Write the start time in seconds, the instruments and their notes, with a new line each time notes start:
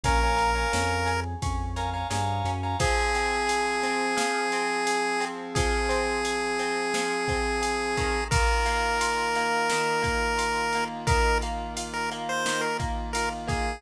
0.04 synth bass 1 A#1, acoustic guitar (steel) C#4, lead 1 (square) A#4, electric piano 2 C#5 F5 G#5 A#5, kick, ride
0.23 electric piano 2 C#5 F5 G#5 A#5
0.37 acoustic guitar (steel) A#4, ride
0.55 electric piano 2 C#5 F5 G#5 A#5
0.73 synth bass 1 F2, acoustic guitar (steel) C#4, snare
1.06 acoustic guitar (steel) G#4, ride
1.42 synth bass 1 F2, acoustic guitar (steel) C#4, kick, ride
1.76 acoustic guitar (steel) A#4, electric piano 2 C#5 F5 G#5 A#5, ride
1.93 electric piano 2 C#5 F5 G#5 A#5
2.10 synth bass 1 G2, acoustic guitar (steel) G#4, electric piano 2 C#5 F5 G#5 A#5, snare
2.45 synth bass 1 F#2, acoustic guitar (steel) C#4, ride
2.63 electric piano 2 C#5 F5 G#5 A#5
2.79 electric piano 2 F3 C4 G#4, acoustic guitar (steel) F3, lead 1 (square) G#4, kick, ride
3.15 acoustic guitar (steel) C4, ride
3.47 acoustic guitar (steel) G#4, ride
3.83 acoustic guitar (steel) C4, ride
4.17 acoustic guitar (steel) F3, snare
4.52 acoustic guitar (steel) C4, ride
4.87 acoustic guitar (steel) G#4, ride
5.20 acoustic guitar (steel) C4, ride
5.55 acoustic guitar (steel) F3, lead 1 (square) G#4, kick, ride
5.89 acoustic guitar (steel) C4, ride
6.25 acoustic guitar (steel) G#4, ride
6.59 acoustic guitar (steel) C4, ride
6.94 acoustic guitar (steel) F3, snare
7.28 acoustic guitar (steel) C4, kick, ride
7.62 acoustic guitar (steel) G#4, ride
7.97 acoustic guitar (steel) D#3, kick, ride
8.31 electric piano 2 D#3 A#3 F4, lead 1 (square) A#4, kick, ride
8.66 acoustic guitar (steel) A#3, ride
9.01 acoustic guitar (steel) F4, ride
9.35 acoustic guitar (steel) A#3, ride
9.70 acoustic guitar (steel) D#3, snare
10.02 acoustic guitar (steel) A#3, kick, ride
10.38 acoustic guitar (steel) F4, ride
10.73 acoustic guitar (steel) A#3, ride
11.07 acoustic guitar (steel) D#3, lead 1 (square) A#4, kick, ride
11.42 acoustic guitar (steel) A#3, ride
11.77 acoustic guitar (steel) F4, ride
11.94 lead 1 (square) A#4
12.11 acoustic guitar (steel) A#3, ride
12.29 lead 1 (square) C5
12.46 acoustic guitar (steel) D#3, snare
12.61 lead 1 (square) A#4
12.79 acoustic guitar (steel) A#3, kick, ride
13.13 acoustic guitar (steel) F4, lead 1 (square) A#4, ride
13.48 acoustic guitar (steel) A#3, lead 1 (square) G#4, kick, ride